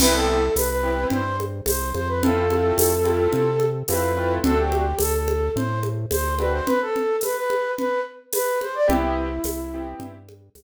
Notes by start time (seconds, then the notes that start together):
0.00 C2 B3 C4 E4 G4 B4, crash, low conga
0.13 A4
0.55 C2 B4, tambourine, high conga
0.70 B4
0.83 B3 C4 E4 G4
1.10 G2 C5, low conga
1.40 high conga
1.66 C2 C5, tambourine, high conga
1.94 F2 C5, high conga
2.08 B4
2.23 A3 C4 E4 F4 A4, low conga
2.50 A3 C4 E4 F4, high conga
2.78 F2, tambourine, high conga
3.04 A3 C4 E4 F4, high conga
3.33 C3, low conga
3.60 high conga
3.88 F2 A3 C4 E4 F4 B4, tambourine, high conga
4.17 A3 C4 E4 F4
4.44 D2 A3 C4 D4 F#4 A4, low conga
4.58 G4
4.72 high conga
4.99 D2 A4, tambourine, high conga
5.14 A4
5.28 high conga
5.56 A2 C5, low conga
5.83 high conga
6.11 D2 C5, tambourine, high conga
6.39 A3 C4 D4 F#4 B4, high conga
6.53 C5
6.66 B4, low conga
6.81 A4
6.96 low conga
7.21 B4, tambourine, high conga
7.36 B4
7.50 high conga
7.78 B4, low conga
8.33 B4, tambourine, high conga
8.61 C5, high conga
8.75 D5
8.88 C2 B3 C4 E4 G4, low conga
9.44 C2, tambourine, high conga
9.74 B3 C4 E4 G4
10.00 G2, low conga
10.29 high conga
10.55 C2, tambourine, high conga